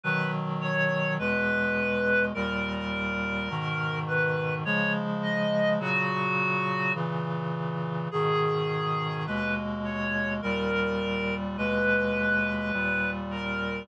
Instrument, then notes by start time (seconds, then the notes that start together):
clarinet
0.04 B2 D#3 F#3 B4
0.61 C#5
1.19 E2 B2 G#3 B4
2.34 D#2 A#2 G3 A#4
3.50 G#2 B2 D#3
4.07 B4
4.65 C#3 F3 G#3 C#5
5.23 D#5
5.79 A#2 C#3 F#3 F#4
6.94 A#2 C#3 E3
8.11 G#2 B2 D#3 G#4
9.27 D#2 B2 G#3 B4
9.84 C#5
10.42 D#2 A#2 G3 A#4
11.57 D#2 B2 G#3 B4
12.73 D#2 A#2 G3
13.31 A#4